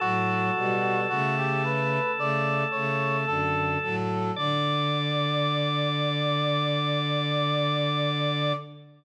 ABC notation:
X:1
M:4/4
L:1/16
Q:1/4=55
K:D
V:1 name="Brass Section"
F4 F G B2 d2 c2 A2 A2 | d16 |]
V:2 name="Drawbar Organ"
A16 | d16 |]
V:3 name="Violin"
[A,,F,]2 [B,,G,]2 [C,A,]4 [C,A,]2 [C,A,]2 [F,,D,]2 [A,,F,]2 | D,16 |]